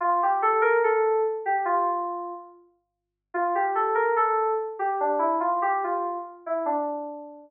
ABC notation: X:1
M:2/4
L:1/16
Q:1/4=72
K:Dm
V:1 name="Electric Piano 2"
F G A B A2 z G | F4 z4 | F G A B A2 z G | D E F G F2 z E |
D4 z4 |]